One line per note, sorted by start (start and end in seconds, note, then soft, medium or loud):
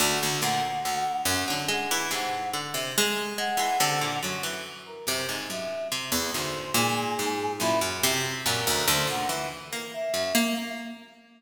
0.00 0.18 D2 medium
0.00 0.38 D3 medium
0.00 0.37 F#5 medium
0.23 0.41 D2 medium
0.41 0.61 D2 medium
0.41 0.81 A#2 loud
0.41 1.17 F#5 loud
0.85 1.04 D2 medium
0.85 1.42 D3 medium
1.25 1.44 F#2 medium
1.25 1.46 F#5 medium
1.48 1.69 D3 medium
1.48 1.67 F#3 medium
1.48 1.67 F#5 medium
1.68 2.07 G#3 loud
1.68 2.07 F#5 medium
1.91 2.10 E3 medium
2.11 2.49 G#2 medium
2.11 2.49 C3 medium
2.11 2.50 F#5 medium
2.54 3.30 D3 medium
2.74 2.93 C3 medium
2.98 3.36 G#3 loud
3.38 3.57 G#3 medium
3.38 3.95 F#5 loud
3.57 3.76 E3 medium
3.57 3.78 G#3 medium
3.80 3.99 C3 medium
3.80 4.18 D3 loud
4.01 4.20 A#2 medium
4.01 4.20 F#5 medium
4.23 4.99 F#2 medium
4.23 4.43 F#3 medium
4.43 4.62 E3 medium
4.86 5.05 A#4 medium
5.07 5.45 F#2 medium
5.07 5.27 C3 medium
5.29 5.48 G#2 medium
5.50 5.88 F#2 medium
5.50 5.88 E5 medium
5.92 6.11 C3 loud
6.12 6.31 E2 medium
6.34 6.72 D2 medium
6.34 6.72 G#2 medium
6.34 6.73 C5 medium
6.74 7.52 G#2 medium
6.74 7.12 A#2 loud
6.74 7.53 G#4 medium
7.19 7.57 G#2 medium
7.60 7.98 F#2 medium
7.60 7.80 A#2 medium
7.60 7.79 E4 loud
7.81 8.38 F#2 loud
8.03 8.41 C3 loud
8.45 8.84 F#2 loud
8.45 8.65 A#2 medium
8.45 8.83 A#4 loud
8.67 8.86 D2 medium
8.87 9.07 D2 loud
8.87 9.64 F#2 medium
8.87 9.07 C5 medium
9.07 9.26 A#2 medium
9.07 9.28 F#5 medium
9.29 9.48 E3 medium
9.73 9.92 A#3 medium
9.93 10.50 E5 medium
10.14 10.33 F#2 medium
10.35 10.54 A#3 loud